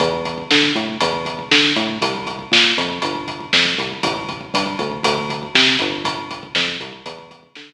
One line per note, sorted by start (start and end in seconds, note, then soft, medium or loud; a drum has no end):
0.00 0.43 E2 loud
0.00 kick medium
0.00 closed hi-hat medium
0.13 kick medium
0.25 kick medium
0.25 closed hi-hat medium
0.38 kick medium
0.51 0.72 D3 medium
0.51 kick medium
0.51 snare medium
0.63 kick medium
0.75 0.97 A2 medium
0.75 kick medium
0.75 closed hi-hat medium
0.89 kick medium
1.01 1.44 E2 loud
1.01 kick medium
1.01 closed hi-hat loud
1.13 kick medium
1.25 kick medium
1.25 closed hi-hat medium
1.39 kick medium
1.51 1.72 D3 medium
1.51 kick medium
1.51 snare loud
1.64 kick medium
1.76 1.98 A2 medium
1.76 kick medium
1.76 closed hi-hat medium
1.89 kick medium
2.02 2.45 C2 medium
2.02 kick medium
2.02 closed hi-hat medium
2.15 kick medium
2.27 kick medium
2.27 closed hi-hat medium
2.39 kick medium
2.52 2.73 A#2 medium
2.52 kick medium
2.52 snare loud
2.64 kick medium
2.78 2.99 F2 medium
2.78 kick medium
2.78 closed hi-hat medium
2.90 kick medium
3.02 3.46 G1 medium
3.02 kick medium
3.02 closed hi-hat medium
3.15 kick medium
3.28 kick medium
3.28 closed hi-hat medium
3.40 kick medium
3.53 3.75 F2 medium
3.53 kick medium
3.53 snare medium
3.65 kick medium
3.78 4.00 C2 medium
3.78 kick medium
3.78 closed hi-hat medium
3.91 kick medium
4.03 4.46 A1 loud
4.03 kick loud
4.03 closed hi-hat medium
4.16 kick medium
4.29 kick medium
4.29 closed hi-hat medium
4.41 kick medium
4.54 4.75 G2 medium
4.54 kick medium
4.54 closed hi-hat medium
4.66 kick medium
4.79 5.01 D2 medium
4.79 kick medium
4.79 closed hi-hat medium
4.91 kick medium
5.03 5.47 D2 loud
5.03 kick medium
5.03 closed hi-hat loud
5.18 kick medium
5.30 kick medium
5.30 closed hi-hat medium
5.43 kick medium
5.55 5.76 C3 medium
5.55 kick medium
5.55 snare loud
5.67 kick medium
5.79 6.48 G1 loud
5.79 kick medium
5.79 closed hi-hat medium
5.92 kick medium
6.05 kick medium
6.05 closed hi-hat medium
6.18 kick medium
6.31 kick medium
6.31 closed hi-hat medium
6.43 kick medium
6.55 6.77 F2 medium
6.55 kick medium
6.55 snare medium
6.68 kick medium
6.80 7.02 C2 medium
6.80 kick medium
6.80 closed hi-hat medium
6.92 kick medium
7.06 7.49 E2 medium
7.06 kick medium
7.06 closed hi-hat medium
7.18 kick medium
7.31 kick medium
7.31 closed hi-hat medium
7.43 kick medium
7.55 7.73 D3 medium
7.55 kick medium
7.55 snare medium
7.69 kick medium